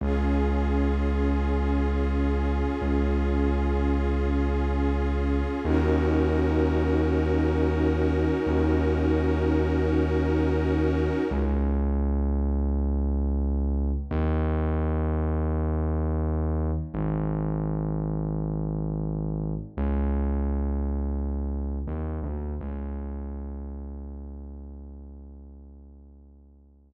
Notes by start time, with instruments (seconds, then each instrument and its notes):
0.01 synth bass 2 C#2, pad 5 (bowed) C#4 F4 G#4
2.82 synth bass 2 C#2
5.64 synth bass 2 D#2, pad 5 (bowed) C#4 D#4 F#4 A#4
8.46 synth bass 2 D#2
11.31 synth bass 2 C#2
14.11 synth bass 2 D#2
16.94 synth bass 2 G#1
19.77 synth bass 2 C#2
21.87 synth bass 2 D#2
22.23 synth bass 2 D2
22.61 synth bass 2 C#2